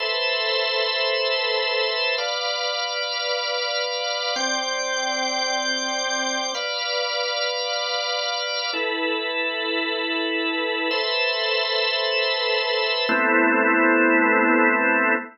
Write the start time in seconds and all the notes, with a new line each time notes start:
0.00 A4 B4 C5 E5
2.18 B4 D5 F5
4.36 C4 D5 G5
6.55 B4 D5 F5
8.73 E4 A4 B4
10.91 A4 B4 C5 E5
13.09 A3 B3 C4 E4